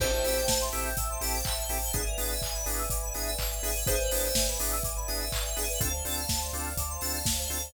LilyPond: <<
  \new Staff \with { instrumentName = "Electric Piano 2" } { \time 4/4 \key a \minor \tempo 4 = 124 c''4. r2 r8 | r1 | c''4. r2 r8 | r1 | }
  \new Staff \with { instrumentName = "Drawbar Organ" } { \time 4/4 \key a \minor <c' e' g' a'>8 <c' e' g' a'>4 <c' e' g' a'>4 <c' e' g' a'>4 <c' e' g' a'>8 | <b d' e' gis'>8 <b d' e' gis'>4 <b d' e' gis'>4 <b d' e' gis'>4 <b d' e' gis'>8 | <b d' e' gis'>8 <b d' e' gis'>4 <b d' e' gis'>4 <b d' e' gis'>4 <b d' e' gis'>8 | <c' d' f' a'>8 <c' d' f' a'>4 <c' d' f' a'>4 <c' d' f' a'>4 <c' d' f' a'>8 | }
  \new Staff \with { instrumentName = "Electric Piano 2" } { \time 4/4 \key a \minor a'16 c''16 e''16 g''16 a''16 c'''16 e'''16 g'''16 e'''16 c'''16 a''16 g''16 e''16 c''16 a'16 c''16 | gis'16 bes'16 d''16 e''16 gis''16 b''16 d'''16 e'''16 d'''16 b''16 gis''16 e''16 d''16 b'16 gis'16 b'16 | gis'16 b'16 d''16 e''16 gis''16 b''16 d'''16 e'''16 d'''16 b''16 gis''16 e''16 d''16 b'16 gis'16 b'16 | a'16 c''16 d''16 f''16 a''16 c'''16 d'''16 f'''16 d'''16 c'''16 a''16 f''16 d''16 c''16 a'16 c''16 | }
  \new Staff \with { instrumentName = "Synth Bass 2" } { \clef bass \time 4/4 \key a \minor a,,8 a,,8 a,,8 a,,8 a,,8 a,,8 a,,8 a,,8 | gis,,8 gis,,8 gis,,8 gis,,8 gis,,8 gis,,8 gis,,8 gis,,8 | gis,,8 gis,,8 gis,,8 gis,,8 gis,,8 gis,,8 gis,,8 gis,,8 | d,8 d,8 d,8 d,8 d,8 d,8 d,8 d,8 | }
  \new Staff \with { instrumentName = "String Ensemble 1" } { \time 4/4 \key a \minor <c'' e'' g'' a''>1 | <b' d'' e'' gis''>1 | <b' d'' e'' gis''>1 | <c'' d'' f'' a''>1 | }
  \new DrumStaff \with { instrumentName = "Drums" } \drummode { \time 4/4 <cymc bd>8 hho8 <bd sn>8 hho8 <hh bd>8 hho8 <hc bd>8 hho8 | <hh bd>8 hho8 <hc bd>8 hho8 <hh bd>8 hho8 <hc bd>8 hho8 | <hh bd>8 hho8 <bd sn>8 hho8 <hh bd>8 hho8 <hc bd>8 hho8 | <hh bd>8 hho8 <bd sn>8 hho8 <hh bd>8 hho8 <bd sn>8 hho8 | }
>>